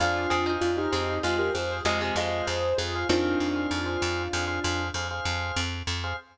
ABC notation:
X:1
M:5/4
L:1/16
Q:1/4=97
K:Fdor
V:1 name="Acoustic Grand Piano"
[DF]4 [DF] [EG]3 [FA] [GB] [Ac]2 [FA]2 [Ac]2 [Ac]2 [FA]2 | [DF]12 z8 |]
V:2 name="Pizzicato Strings"
z2 [CA] [Ec]3 [CA]2 [A,F]2 z2 [C,A,] [C,A,] [A,F]2 z4 | [E,C]6 z14 |]
V:3 name="Drawbar Organ"
[Acf]3 [Acf]2 [Acf]3 [Acf] [Acf] [Acf]2 [Acf] [Acf]6 [Acf] | [Acf]3 [Acf]2 [Acf]3 [Acf] [Acf] [Acf]2 [Acf] [Acf]6 [Acf] |]
V:4 name="Electric Bass (finger)" clef=bass
F,,2 F,,2 F,,2 F,,2 F,,2 F,,2 F,,2 F,,2 F,,2 F,,2 | F,,2 F,,2 F,,2 F,,2 F,,2 F,,2 F,,2 F,,2 F,,2 F,,2 |]